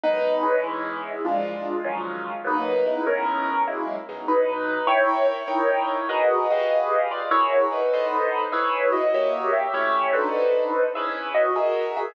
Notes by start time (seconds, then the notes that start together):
0.04 B2 D#3 F#3 G#3 D#4 B4
0.42 E3 G#3 B3 C#4
0.63 G#3 E4
1.25 A#2 F3 G#3 D4 F4
1.84 D#3 F3 F#3 C#4
2.44 G#2 F#3 A#3 B3 D#4 B4
2.86 C#3 G#3 B3 E4
3.07 C#4 A#4
3.68 F#3 G#3 A#3 E4
4.09 B2 F#3 G#3 D#4
4.28 D#4 B4
4.87 E4 A#4 C#5 E5 G5
5.28 E4 C#5
5.48 D#4 A#4 C#5 G5
6.09 F#4 G#4 A#4 B4 D#5 F#5
6.50 F#4 G4 G#4 B4 D#5 F5
7.11 F4 D5
7.31 E4 F#4 G#4 A#4 C#5 E5
7.72 D#4 B4
7.94 B3 A4 C5 D#5
8.52 E4 G#4 B4 C#5 E5
8.92 F#4 D#5
9.14 A#3 G4 C#5 E5
9.53 G4 E5
9.74 A3 C#4 E4 G4 C#5 E5
10.13 D4 D#4 F#4 A4 B4 C5
10.95 C#4 E4 G#4 B4 E5
11.34 F#4 D#5
11.56 F#4 G#4 A#4 E5
11.97 G#4 E5